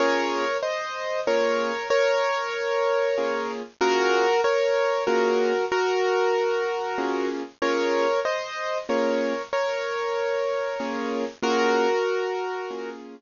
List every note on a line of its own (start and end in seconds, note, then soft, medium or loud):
0.00 0.44 A#3 loud
0.00 0.44 C#4 loud
0.00 0.44 F4 loud
0.00 0.44 G#4 loud
0.00 0.57 A#4 loud
0.00 0.57 C#5 loud
0.63 1.20 C5 medium
0.63 1.20 D#5 loud
1.27 1.72 A#3 medium
1.27 1.72 C#4 medium
1.27 1.72 F4 medium
1.27 1.72 G#4 medium
1.27 1.88 A#4 loud
1.27 1.88 C#5 loud
1.90 3.51 A#4 loud
1.90 3.51 C#5 loud
3.17 3.62 A#3 medium
3.17 3.62 C#4 medium
3.17 3.62 F4 medium
3.17 3.62 G#4 medium
3.81 4.25 A#3 loud
3.81 4.25 C#4 loud
3.81 4.25 F4 loud
3.81 4.41 F#4 loud
3.81 4.25 G#4 loud
3.81 4.41 A#4 loud
4.44 5.04 A#4 loud
4.44 5.04 C#5 loud
5.07 5.52 A#3 medium
5.07 5.52 C#4 loud
5.07 5.52 F4 medium
5.07 5.65 F#4 medium
5.07 5.52 G#4 medium
5.07 5.65 A#4 loud
5.72 7.28 F#4 loud
5.72 7.28 A#4 loud
6.98 7.42 A#3 medium
6.98 7.42 C#4 loud
6.98 7.42 F4 medium
6.98 7.42 G#4 medium
7.62 8.06 A#3 medium
7.62 8.06 C#4 loud
7.62 8.06 F4 loud
7.62 8.06 G#4 loud
7.62 8.20 A#4 loud
7.62 8.20 C#5 loud
8.25 8.78 C5 medium
8.25 8.78 D#5 loud
8.89 9.33 A#3 loud
8.89 9.33 C#4 loud
8.89 9.33 F4 medium
8.89 9.33 G#4 medium
8.89 9.42 A#4 medium
8.89 9.42 C#5 medium
9.53 11.25 A#4 medium
9.53 11.25 C#5 loud
10.80 11.24 A#3 medium
10.80 11.24 C#4 medium
10.80 11.24 F4 medium
10.80 11.24 G#4 loud
11.42 11.87 A#3 loud
11.42 11.87 C#4 loud
11.42 11.87 F4 loud
11.42 12.90 F#4 loud
11.42 11.87 G#4 loud
11.42 12.90 A#4 loud
12.70 13.15 A#3 medium
12.70 13.15 C#4 medium
12.70 13.15 F4 medium
12.70 13.15 G#4 medium